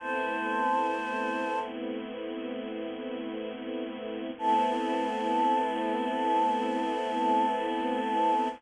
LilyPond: <<
  \new Staff \with { instrumentName = "Choir Aahs" } { \time 4/4 \key a \phrygian \tempo 4 = 55 <c'' a''>4. r2 r8 | a''1 | }
  \new Staff \with { instrumentName = "String Ensemble 1" } { \time 4/4 \key a \phrygian <a b c' e'>1 | <a b c' e'>1 | }
>>